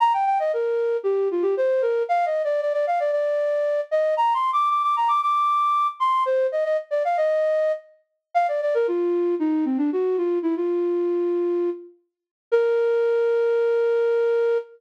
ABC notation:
X:1
M:4/4
L:1/16
Q:1/4=115
K:Bb
V:1 name="Flute"
b g g e B4 G2 F G c2 B2 | (3f2 e2 d2 d d f d d6 e2 | (3b2 c'2 d'2 d' d' b d' d'6 c'2 | c2 e e z d f e5 z4 |
f d d B F4 E2 C D _G2 F2 | =E F9 z6 | B16 |]